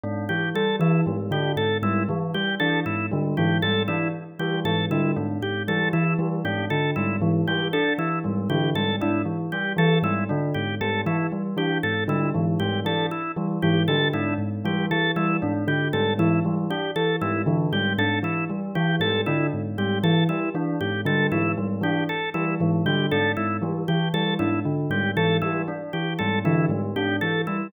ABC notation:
X:1
M:5/4
L:1/8
Q:1/4=117
K:none
V:1 name="Tubular Bells" clef=bass
^G,, E, z E, G,, D, G,, G,, | E, z E, ^G,, D, G,, G,, E, z E, | ^G,, D, G,, G,, E, z E, G,, D, G,, | ^G,, E, z E, G,, D, G,, G,, E, z |
E, ^G,, D, G,, G,, E, z E, G,, D, | ^G,, G,, E, z E, G,, D, G,, G,, E, | z E, ^G,, D, G,, G,, E, z E, G,, | D, ^G,, G,, E, z E, G,, D, G,, G,, |
E, z E, ^G,, D, G,, G,, E, z E, | ^G,, D, G,, G,, E, z E, G,, D, G,, | ^G,, E, z E, G,, D, G,, G,, E, z |]
V:2 name="Tubular Bells"
D z G, E, G, D z G, | E, G, D z G, E, G, D z G, | E, G, D z G, E, G, D z G, | E, G, D z G, E, G, D z G, |
E, G, D z G, E, G, D z G, | E, G, D z G, E, G, D z G, | E, G, D z G, E, G, D z G, | E, G, D z G, E, G, D z G, |
E, G, D z G, E, G, D z G, | E, G, D z G, E, G, D z G, | E, G, D z G, E, G, D z G, |]
V:3 name="Drawbar Organ"
z G A E z G A E | z G A E z G A E z G | A E z G A E z G A E | z G A E z G A E z G |
A E z G A E z G A E | z G A E z G A E z G | A E z G A E z G A E | z G A E z G A E z G |
A E z G A E z G A E | z G A E z G A E z G | A E z G A E z G A E |]